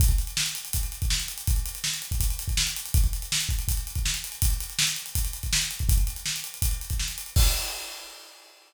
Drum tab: CC |----------------|----------------|----------------|----------------|
HH |xxxx-xxxxxxx-xxx|xxxx-xxxxxxx-xxx|xxxx-xxxxxxx-xxx|xxxx-xxxxxxx-xxx|
SD |----o-------o---|----o-------o---|----o-------o---|----o-------o---|
BD |oo------o--o----|o------oo--o----|oo----o-o--o----|o-------o--o---o|

CC |----------------|x---------------|
HH |xxxx-xxxxxxx-xxx|----------------|
SD |----o-------o---|----------------|
BD |oo------o--o----|o---------------|